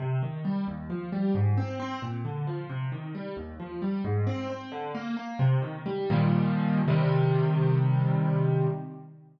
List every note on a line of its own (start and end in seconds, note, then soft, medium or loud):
0.00 0.20 C3 loud
0.23 0.43 D#3 medium
0.45 0.65 G3 medium
0.68 0.88 D#2 medium
0.90 1.10 F3 medium
1.12 1.33 G3 medium
1.35 1.55 G#2 loud
1.57 1.78 C4 medium
1.80 2.00 C4 medium
2.02 2.23 A#2 medium
2.25 2.45 D3 medium
2.47 2.67 F3 medium
2.70 2.90 C3 loud
2.92 3.12 D#3 medium
3.15 3.35 G3 medium
3.37 3.57 D#2 loud
3.60 3.80 F3 medium
3.82 4.02 G3 medium
4.04 4.25 G#2 loud
4.27 4.47 C4 medium
4.50 4.70 C4 medium
4.72 4.92 D3 medium
4.95 5.15 A#3 medium
5.17 5.37 A#3 medium
5.39 5.60 C3 loud
5.62 5.83 D#3 medium
5.86 6.08 G3 medium
6.10 6.80 A#2 loud
6.10 6.80 D#3 loud
6.10 6.80 F3 loud
6.10 6.80 G3 medium
6.88 8.67 C3 loud
6.88 8.67 D#3 loud
6.88 8.67 G3 loud